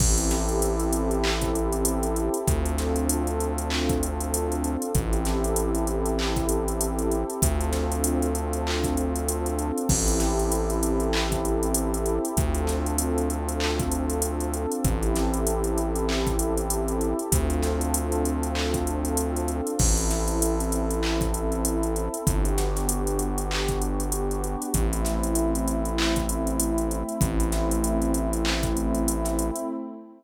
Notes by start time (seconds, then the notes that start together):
0.00 A1 C4 E4 G4 A4, kick, crash
0.18 closed hi-hat
0.31 snare, closed hi-hat
0.49 closed hi-hat
0.62 closed hi-hat
0.80 closed hi-hat
0.93 closed hi-hat
1.11 closed hi-hat
1.24 clap
1.41 kick, closed hi-hat
1.55 closed hi-hat
1.73 closed hi-hat
1.85 closed hi-hat
2.03 closed hi-hat
2.16 closed hi-hat
2.34 closed hi-hat
2.47 D2 C4 D4 F4 A4, kick, closed hi-hat
2.65 closed hi-hat
2.78 snare, closed hi-hat
2.96 closed hi-hat
3.09 closed hi-hat
3.27 closed hi-hat
3.40 closed hi-hat
3.58 closed hi-hat
3.70 clap
3.89 kick, closed hi-hat
4.03 closed hi-hat
4.20 closed hi-hat
4.34 closed hi-hat
4.52 closed hi-hat
4.64 closed hi-hat
4.82 closed hi-hat
4.95 A1 C4 E4 G4 A4, kick, closed hi-hat
5.13 closed hi-hat
5.25 snare, closed hi-hat
5.44 closed hi-hat
5.56 closed hi-hat
5.75 closed hi-hat
5.87 closed hi-hat
6.06 closed hi-hat
6.19 clap
6.36 kick, closed hi-hat
6.49 closed hi-hat
6.68 closed hi-hat
6.81 closed hi-hat
6.99 closed hi-hat
7.11 closed hi-hat
7.30 closed hi-hat
7.42 D2 C4 D4 F4 A4, kick, closed hi-hat
7.61 closed hi-hat
7.73 snare, closed hi-hat
7.92 closed hi-hat
8.04 closed hi-hat
8.22 closed hi-hat
8.35 closed hi-hat
8.53 closed hi-hat
8.67 clap
8.84 kick, closed hi-hat
8.97 closed hi-hat
9.16 closed hi-hat
9.28 closed hi-hat
9.46 closed hi-hat
9.59 closed hi-hat
9.78 closed hi-hat
9.89 A1 C4 E4 G4 A4, kick, crash
10.08 closed hi-hat
10.20 snare, closed hi-hat
10.39 closed hi-hat
10.52 closed hi-hat
10.70 closed hi-hat
10.83 closed hi-hat
11.00 closed hi-hat
11.13 clap
11.32 kick, closed hi-hat
11.45 closed hi-hat
11.63 closed hi-hat
11.74 closed hi-hat
11.94 closed hi-hat
12.06 closed hi-hat
12.25 closed hi-hat
12.37 D2 C4 D4 F4 A4, kick, closed hi-hat
12.55 closed hi-hat
12.67 snare, closed hi-hat
12.86 closed hi-hat
12.98 closed hi-hat
13.18 closed hi-hat
13.30 closed hi-hat
13.49 closed hi-hat
13.60 clap
13.80 kick, closed hi-hat
13.91 closed hi-hat
14.10 closed hi-hat
14.22 closed hi-hat
14.40 closed hi-hat
14.53 closed hi-hat
14.72 closed hi-hat
14.84 A1 C4 E4 G4 A4, kick, closed hi-hat
15.03 closed hi-hat
15.15 snare, closed hi-hat
15.34 closed hi-hat
15.47 closed hi-hat
15.64 closed hi-hat
15.78 closed hi-hat
15.95 closed hi-hat
16.09 clap
16.27 kick, closed hi-hat
16.39 closed hi-hat
16.57 closed hi-hat
16.70 closed hi-hat
16.88 closed hi-hat
17.01 closed hi-hat
17.19 closed hi-hat
17.30 D2 C4 D4 F4 A4, kick, closed hi-hat
17.50 closed hi-hat
17.63 snare, closed hi-hat
17.81 closed hi-hat
17.94 closed hi-hat
18.12 closed hi-hat
18.25 closed hi-hat
18.43 closed hi-hat
18.55 clap
18.74 kick, closed hi-hat
18.87 closed hi-hat
19.05 closed hi-hat
19.17 closed hi-hat
19.36 closed hi-hat
19.48 closed hi-hat
19.67 closed hi-hat
19.79 A1 C4 E4 A4, kick, crash
19.97 closed hi-hat
20.11 snare, closed hi-hat
20.28 closed hi-hat
20.42 closed hi-hat
20.60 closed hi-hat
20.72 closed hi-hat
20.90 closed hi-hat
21.03 clap
21.21 kick, closed hi-hat
21.34 closed hi-hat
21.52 closed hi-hat
21.65 closed hi-hat
21.83 closed hi-hat
21.96 closed hi-hat
22.14 closed hi-hat
22.27 G1 B3 D4 F#4 G4, kick, closed hi-hat
22.45 closed hi-hat
22.58 snare, closed hi-hat
22.76 snare, closed hi-hat
22.89 closed hi-hat
23.07 closed hi-hat
23.19 closed hi-hat
23.38 closed hi-hat
23.51 clap
23.68 kick, closed hi-hat
23.82 closed hi-hat
24.00 closed hi-hat
24.12 closed hi-hat
24.31 closed hi-hat
24.44 closed hi-hat
24.62 closed hi-hat
24.74 A1 A3 C4 E4, kick, closed hi-hat
24.93 closed hi-hat
25.05 snare, closed hi-hat
25.23 closed hi-hat
25.35 closed hi-hat
25.55 closed hi-hat
25.68 closed hi-hat
25.85 closed hi-hat
25.98 clap
26.16 kick, closed hi-hat
26.29 closed hi-hat
26.47 closed hi-hat
26.60 closed hi-hat
26.78 closed hi-hat
26.91 closed hi-hat
27.09 closed hi-hat
27.21 A1 A3 C4 E4, kick, closed hi-hat
27.40 closed hi-hat
27.52 snare, closed hi-hat
27.71 closed hi-hat
27.84 closed hi-hat
28.02 closed hi-hat
28.14 closed hi-hat
28.33 closed hi-hat
28.45 clap
28.63 kick, closed hi-hat
28.77 closed hi-hat
28.95 closed hi-hat
29.08 closed hi-hat
29.25 snare, closed hi-hat
29.39 closed hi-hat
29.56 closed hi-hat